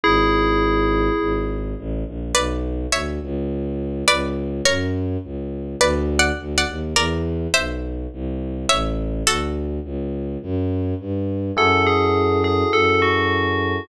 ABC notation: X:1
M:4/4
L:1/8
Q:1/4=104
K:F#dor
V:1 name="Tubular Bells"
[EG]5 z3 | [K:Bdor] z8 | z8 | z8 |
z8 | [K:F#dor] A G2 G A F3 |]
V:2 name="Pizzicato Strings"
z8 | [K:Bdor] [Bd]2 [ce]4 [Bd]2 | [^Ac]4 (3[Bd]2 [df]2 [df]2 | [_Bd]2 [=ce]4 [^ce]2 |
[FA]6 z2 | [K:F#dor] z8 |]
V:3 name="Electric Piano 1"
z8 | [K:Bdor] z8 | z8 | z8 |
z8 | [K:F#dor] [EFGA]8 |]
V:4 name="Violin" clef=bass
G,,,4 G,,,2 A,,, ^A,,, | [K:Bdor] B,,,2 D,, C,,3 C,,2 | F,,2 C,,2 D,,2 D,, ^D,, | E,,2 B,,,2 =C,,2 A,,,2 |
D,,2 C,,2 F,,2 =G,,2 | [K:F#dor] F,,4 F,,4 |]